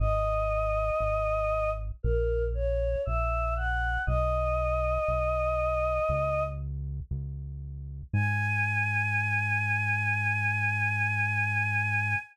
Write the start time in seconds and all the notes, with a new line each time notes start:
0.00 G#1 D#5
1.00 G#1
2.03 A#1 A#4
2.54 C#5
3.05 A#1 E5
3.56 F#5
4.07 B1 D#5
5.08 B1
6.09 C#2
7.11 C#2
8.13 G#2 G#5